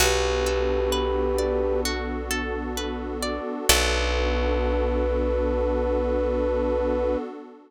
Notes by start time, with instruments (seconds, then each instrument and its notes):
0.00 electric bass (finger) B1, pad 2 (warm) B3 D4 F#4 A4, orchestral harp F#4, flute G4 B4
0.46 orchestral harp A4
0.92 orchestral harp B4
1.38 orchestral harp D5
1.85 orchestral harp F#4
2.31 orchestral harp A4
2.77 orchestral harp B4
3.23 orchestral harp D5
3.69 electric bass (finger) B1, pad 2 (warm) B3 D4 F#4 A4, orchestral harp F#4 A4 B4 D5, flute B4